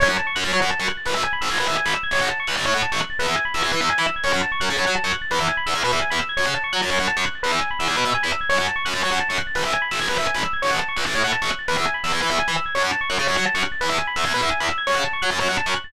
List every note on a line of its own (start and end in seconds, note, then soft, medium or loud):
0.00 0.08 F#2 medium
0.00 0.08 C#5 medium
0.09 0.17 F#2 medium
0.09 0.17 F#5 medium
0.18 0.26 A5 medium
0.27 0.35 C#6 medium
0.35 0.44 F#2 medium
0.35 0.43 F#6 medium
0.44 0.52 F#2 medium
0.44 0.52 A6 medium
0.52 0.60 F#3 medium
0.52 0.61 C#5 medium
0.61 0.70 F#2 medium
0.61 0.69 F#5 medium
0.70 0.78 A5 medium
0.80 0.88 F#2 medium
0.80 0.88 C#6 medium
0.88 0.96 F#6 medium
0.97 1.05 A6 medium
1.06 1.14 G#1 medium
1.06 1.14 B4 medium
1.15 1.23 G#1 medium
1.15 1.23 E5 medium
1.24 1.32 G#5 medium
1.33 1.41 B5 medium
1.41 1.49 G#1 medium
1.41 1.49 E6 medium
1.50 1.58 G#1 medium
1.50 1.58 G#6 medium
1.59 1.67 G#1 medium
1.59 1.68 B4 medium
1.68 1.76 G#1 medium
1.68 1.76 E5 medium
1.77 1.85 G#5 medium
1.86 1.94 G#1 medium
1.86 1.94 B5 medium
1.95 2.03 E6 medium
2.03 2.11 G#6 medium
2.11 2.19 A1 medium
2.11 2.21 C#5 medium
2.21 2.28 A1 medium
2.21 2.29 F#5 medium
2.30 2.38 A5 medium
2.40 2.47 C#6 medium
2.47 2.55 C#2 medium
2.47 2.56 F#6 medium
2.57 2.65 A1 medium
2.57 2.65 A6 medium
2.65 2.74 A2 medium
2.65 2.73 C#5 medium
2.74 2.82 A2 medium
2.74 2.82 F#5 medium
2.83 2.91 A5 medium
2.92 3.00 A1 medium
2.92 3.00 C#6 medium
3.00 3.08 F#6 medium
3.10 3.18 A6 medium
3.19 3.27 E2 medium
3.19 3.27 B4 medium
3.27 3.35 E2 medium
3.27 3.36 E5 medium
3.36 3.44 G#5 medium
3.45 3.53 B5 medium
3.54 3.62 E2 medium
3.54 3.62 E6 medium
3.62 3.72 E2 medium
3.62 3.70 G#6 medium
3.72 3.80 E3 medium
3.72 3.80 B4 medium
3.81 3.89 E2 medium
3.81 3.89 E5 medium
3.90 3.98 G#5 medium
3.98 4.06 E3 medium
3.98 4.06 B5 medium
4.07 4.15 E6 medium
4.16 4.24 G#6 medium
4.24 4.32 F#2 medium
4.24 4.32 C#5 medium
4.33 4.41 F#2 medium
4.33 4.41 F#5 medium
4.43 4.51 A5 medium
4.52 4.60 C#6 medium
4.60 4.69 F#2 medium
4.60 4.68 F#6 medium
4.69 4.78 C#3 medium
4.69 4.77 A6 medium
4.77 4.85 F#2 medium
4.77 4.86 C#5 medium
4.86 4.95 F#3 medium
4.86 4.94 F#5 medium
4.96 5.03 A5 medium
5.04 5.12 F#2 medium
5.04 5.12 C#6 medium
5.13 5.21 F#6 medium
5.22 5.29 A6 medium
5.31 5.39 E2 medium
5.31 5.39 B4 medium
5.40 5.48 E2 medium
5.40 5.48 E5 medium
5.49 5.57 G#5 medium
5.57 5.65 B5 medium
5.66 5.74 E2 medium
5.66 5.74 E6 medium
5.74 5.82 E2 medium
5.74 5.83 G#6 medium
5.84 5.92 B2 medium
5.84 5.92 B4 medium
5.92 6.00 E2 medium
5.92 6.01 E5 medium
6.02 6.10 G#5 medium
6.10 6.19 E2 medium
6.10 6.18 B5 medium
6.19 6.27 E6 medium
6.29 6.37 G#6 medium
6.37 6.45 F#2 medium
6.37 6.45 C#5 medium
6.46 6.54 C#3 medium
6.46 6.54 F#5 medium
6.55 6.63 A5 medium
6.64 6.72 C#6 medium
6.73 6.81 F#3 medium
6.73 6.81 F#6 medium
6.82 6.90 F#2 medium
6.82 6.90 A6 medium
6.90 6.98 F#2 medium
6.90 6.98 C#5 medium
6.99 7.07 F#2 medium
6.99 7.08 F#5 medium
7.08 7.16 A5 medium
7.17 7.25 F#2 medium
7.17 7.24 C#6 medium
7.26 7.34 F#6 medium
7.35 7.43 A6 medium
7.43 7.51 E2 medium
7.43 7.51 B4 medium
7.52 7.60 E2 medium
7.52 7.60 E5 medium
7.61 7.69 G#5 medium
7.71 7.78 B5 medium
7.79 7.88 E2 medium
7.79 7.87 E6 medium
7.88 7.96 E2 medium
7.88 7.96 G#6 medium
7.96 8.04 B2 medium
7.96 8.05 B4 medium
8.05 8.13 B2 medium
8.05 8.13 E5 medium
8.14 8.22 G#5 medium
8.23 8.31 E2 medium
8.23 8.31 B5 medium
8.32 8.40 E6 medium
8.41 8.49 G#6 medium
8.49 8.58 F#2 medium
8.49 8.57 C#5 loud
8.58 8.67 F#2 medium
8.58 8.66 F#5 medium
8.68 8.76 A5 medium
8.76 8.84 C#6 medium
8.85 8.94 F#2 medium
8.85 8.93 F#6 medium
8.94 9.02 F#2 medium
8.94 9.01 A6 medium
9.03 9.12 F#3 medium
9.03 9.11 C#5 medium
9.11 9.19 F#2 medium
9.11 9.19 F#5 medium
9.20 9.28 A5 medium
9.29 9.38 F#2 medium
9.29 9.37 C#6 medium
9.38 9.46 F#6 medium
9.47 9.55 A6 medium
9.55 9.63 G#1 medium
9.55 9.63 B4 medium
9.65 9.73 G#1 medium
9.65 9.73 E5 medium
9.73 9.81 G#5 medium
9.82 9.90 B5 medium
9.91 9.99 G#1 medium
9.91 9.99 E6 medium
10.00 10.08 G#1 medium
10.00 10.08 G#6 medium
10.09 10.17 G#1 medium
10.09 10.17 B4 medium
10.18 10.26 G#1 medium
10.18 10.26 E5 medium
10.27 10.35 G#5 medium
10.34 10.42 G#1 medium
10.34 10.43 B5 medium
10.44 10.52 E6 medium
10.53 10.61 G#6 medium
10.62 10.71 A1 medium
10.62 10.70 C#5 loud
10.71 10.79 A1 medium
10.71 10.79 F#5 medium
10.79 10.87 A5 medium
10.88 10.96 C#6 medium
10.97 11.04 C#2 medium
10.97 11.05 F#6 medium
11.06 11.14 A1 medium
11.06 11.14 A6 medium
11.15 11.23 A2 medium
11.15 11.23 C#5 medium
11.24 11.32 A2 medium
11.24 11.32 F#5 medium
11.32 11.40 A5 medium
11.42 11.50 A1 medium
11.42 11.50 C#6 medium
11.50 11.58 F#6 medium
11.59 11.67 A6 medium
11.68 11.76 E2 medium
11.68 11.76 B4 loud
11.77 11.85 E2 medium
11.77 11.85 E5 medium
11.86 11.94 G#5 medium
11.94 12.02 B5 medium
12.04 12.12 E2 medium
12.04 12.12 E6 medium
12.12 12.20 E2 medium
12.12 12.20 G#6 medium
12.22 12.30 E3 medium
12.22 12.30 B4 medium
12.30 12.38 E2 medium
12.30 12.38 E5 medium
12.39 12.47 G#5 medium
12.48 12.56 E3 medium
12.48 12.56 B5 medium
12.57 12.65 E6 medium
12.66 12.74 G#6 medium
12.75 12.82 F#2 medium
12.75 12.83 C#5 loud
12.83 12.91 F#2 medium
12.83 12.91 F#5 medium
12.92 13.00 A5 medium
13.01 13.09 C#6 medium
13.10 13.18 F#2 medium
13.10 13.18 F#6 medium
13.18 13.27 C#3 medium
13.18 13.26 A6 medium
13.27 13.36 F#2 medium
13.27 13.35 C#5 medium
13.36 13.45 F#3 medium
13.36 13.44 F#5 medium
13.46 13.54 A5 medium
13.54 13.63 F#2 medium
13.54 13.62 C#6 medium
13.63 13.71 F#6 medium
13.72 13.80 A6 medium
13.81 13.89 E2 medium
13.81 13.89 B4 loud
13.89 13.98 E2 medium
13.89 13.97 E5 medium
13.98 14.06 G#5 medium
14.07 14.15 B5 medium
14.16 14.24 E2 medium
14.16 14.24 E6 medium
14.24 14.33 E2 medium
14.24 14.32 G#6 medium
14.33 14.41 B2 medium
14.33 14.42 B4 medium
14.41 14.49 E2 medium
14.41 14.50 E5 medium
14.51 14.59 G#5 medium
14.60 14.68 E2 medium
14.60 14.68 B5 medium
14.69 14.77 E6 medium
14.78 14.86 G#6 medium
14.87 14.95 F#2 loud
14.87 14.95 C#5 loud
14.95 15.03 C#3 medium
14.95 15.03 F#5 medium
15.04 15.12 A5 medium
15.13 15.21 C#6 medium
15.22 15.30 F#3 medium
15.22 15.30 F#6 medium
15.31 15.38 F#2 medium
15.31 15.39 A6 medium
15.39 15.48 F#2 medium
15.39 15.47 C#5 medium
15.49 15.57 F#2 medium
15.49 15.57 F#5 medium
15.57 15.65 A5 medium
15.66 15.74 F#2 medium
15.66 15.74 C#6 medium
15.76 15.84 F#6 medium
15.84 15.92 A6 medium